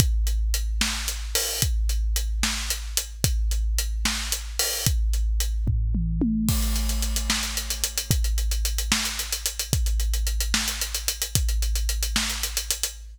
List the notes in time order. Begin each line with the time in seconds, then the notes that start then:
0.00 kick, closed hi-hat
0.27 closed hi-hat
0.54 closed hi-hat
0.81 snare
1.08 closed hi-hat
1.35 open hi-hat
1.62 kick, closed hi-hat
1.89 closed hi-hat
2.16 closed hi-hat
2.43 snare
2.70 closed hi-hat
2.97 closed hi-hat
3.24 kick, closed hi-hat
3.51 closed hi-hat
3.78 closed hi-hat
4.05 snare
4.32 closed hi-hat
4.59 open hi-hat
4.86 kick, closed hi-hat
5.14 closed hi-hat
5.40 closed hi-hat
5.67 kick, floor tom
5.95 mid tom
6.22 high tom
6.49 kick, crash
6.62 closed hi-hat
6.76 closed hi-hat
6.89 closed hi-hat
7.02 closed hi-hat
7.16 closed hi-hat
7.30 snare
7.43 closed hi-hat
7.57 closed hi-hat
7.70 closed hi-hat
7.84 closed hi-hat
7.98 closed hi-hat
8.11 kick, closed hi-hat
8.24 closed hi-hat
8.38 closed hi-hat
8.51 closed hi-hat
8.65 closed hi-hat
8.78 closed hi-hat
8.92 snare
9.05 closed hi-hat
9.19 closed hi-hat
9.33 closed hi-hat
9.46 closed hi-hat
9.59 closed hi-hat
9.73 kick, closed hi-hat
9.86 closed hi-hat
10.00 closed hi-hat
10.14 closed hi-hat
10.27 closed hi-hat
10.41 closed hi-hat
10.54 snare
10.68 closed hi-hat
10.81 closed hi-hat
10.94 closed hi-hat
11.08 closed hi-hat
11.22 closed hi-hat
11.35 kick, closed hi-hat
11.49 closed hi-hat
11.62 closed hi-hat
11.75 closed hi-hat
11.89 closed hi-hat
12.03 closed hi-hat
12.16 snare
12.30 closed hi-hat
12.43 closed hi-hat
12.57 closed hi-hat
12.70 closed hi-hat
12.83 closed hi-hat